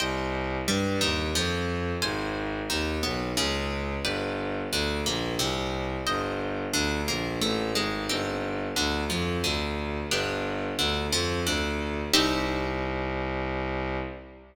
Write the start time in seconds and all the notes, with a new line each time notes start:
0.00 C2 C5 D#5 G5
0.68 G2 G3
1.01 D#2 D#3
1.35 F2 F3
2.02 G#1 C5 F5 G#5
2.70 D#2 D#3
3.03 B1 B3
3.37 C#2 C#3
4.04 G1 B4 D5 G5
4.72 D2 D3
5.05 A#1 A#3
5.39 C2 C3
6.07 G1 C5 D#5 G5
6.73 D2 D3
7.08 A#1 A#3
7.41 A1 A3
7.75 G#1 G#3
8.09 G1 C4 D#4 G4
8.76 D2 D3
9.10 F2 F3
9.43 D2 D3
10.11 G1 B3 D4 G4
10.79 D2 D3
11.12 F2 F3
11.46 D2 D3
12.13 C2 C4 D#4 G4